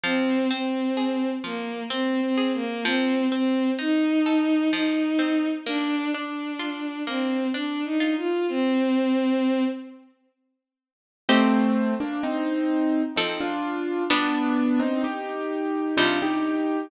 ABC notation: X:1
M:3/4
L:1/16
Q:1/4=64
K:Fdor
V:1 name="Acoustic Grand Piano"
z12 | z12 | z12 | z12 |
[K:Cdor] [A,C]3 [B,D] [CE]4 [CE] [DF]3 | [=B,D]3 [CE] [EG]4 [DF] [EG]3 |]
V:2 name="Violin"
C2 C4 B,2 (3C2 C2 B,2 | C2 C2 E4 E4 | D2 D4 C2 (3D2 E2 F2 | C6 z6 |
[K:Cdor] z12 | z12 |]
V:3 name="Harpsichord"
F,2 C2 A2 F,2 C2 A2 | F,2 C2 E2 =A2 F,2 C2 | B,2 D2 F2 B,2 D2 F2 | z12 |
[K:Cdor] [CEG]8 [F,CA]4 | [G,=B,D]8 [C,G,E]4 |]